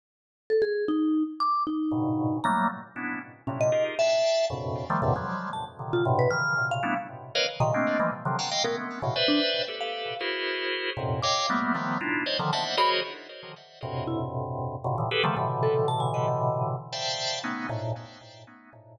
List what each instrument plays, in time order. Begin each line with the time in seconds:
0.50 vibraphone A4
0.62 vibraphone G#4
0.88 vibraphone D#4
1.40 vibraphone D6
1.67 vibraphone D#4
1.91 drawbar organ G2 G#2 A#2 B2 C#3
2.44 drawbar organ F#3 G3 A3 A#3, vibraphone A#5
2.96 drawbar organ B3 C#4 D4 E4
3.47 drawbar organ A2 A#2 C3, vibraphone C#4
3.61 vibraphone D#5
3.72 drawbar organ D#4 F4 G4 G#4 A#4
3.99 drawbar organ D5 E5 F5 G5 A5, vibraphone E5
4.50 drawbar organ F2 F#2 G2 A2 B2 C#3
4.90 drawbar organ D#3 F3 G3 A3
5.02 drawbar organ E2 F#2 G#2 A#2 C3 D3
5.16 drawbar organ F3 F#3 G3 G#3
5.53 vibraphone A5
5.79 drawbar organ A#2 C3 D3 D#3
5.93 vibraphone F4
6.05 drawbar organ G2 A2 B2 C3
6.19 vibraphone B4
6.31 drawbar organ C#3 D#3 E3, vibraphone F6
6.57 drawbar organ A#2 C3 C#3
6.71 vibraphone F5
6.83 drawbar organ G3 A3 B3 C#4 D4 E4
7.35 drawbar organ A#4 B4 C#5 D#5 F5
7.60 drawbar organ A#2 C3 C#3 D#3, vibraphone D#5
7.74 drawbar organ G#3 A3 A#3 C4 D4
7.99 drawbar organ E3 F3 G3 G#3 A3 A#3
8.25 drawbar organ C3 D3 D#3 F3 F#3
8.39 drawbar organ F5 F#5 G5 A5 A#5
8.51 drawbar organ D#5 F5 G5
8.64 drawbar organ G#3 A3 B3 C#4, vibraphone A#4
9.02 drawbar organ A2 B2 C#3
9.16 drawbar organ B4 C5 D5 E5
9.28 vibraphone D4
9.68 drawbar organ G4 A4 B4
9.81 vibraphone F5
10.21 drawbar organ E4 F#4 G#4 A#4 C5
10.97 drawbar organ F2 F#2 G#2 A#2 C3
11.23 drawbar organ C#5 D#5 F5 G5, vibraphone D6
11.50 drawbar organ G3 A3 A#3 B3
11.75 drawbar organ D#3 F3 G3 A3 B3
12.01 drawbar organ D4 D#4 E4 F4
12.26 drawbar organ C5 C#5 D5 D#5
12.39 drawbar organ D3 D#3 F3
12.53 drawbar organ C5 D5 D#5 E5 F#5, vibraphone A5
12.77 drawbar organ F#4 G#4 A#4 C5 C#5 D#5, vibraphone B5
13.83 drawbar organ F2 G2 A2 B2 C3
14.07 vibraphone E4
14.84 drawbar organ F#2 G#2 A#2 B2 C3 C#3
14.98 drawbar organ A2 A#2 C3 D3 D#3 E3
15.11 drawbar organ G4 G#4 A4 B4
15.23 drawbar organ C#3 D3 D#3 F3 G3 A3
15.37 drawbar organ A2 B2 C3 D3 E3
15.63 vibraphone A4
15.88 vibraphone A5
16.00 vibraphone G#5
16.14 vibraphone D#5
16.93 drawbar organ C5 D5 E5 F5 G5 A5
17.44 drawbar organ A3 B3 C#4 D#4
17.69 drawbar organ G#2 A2 A#2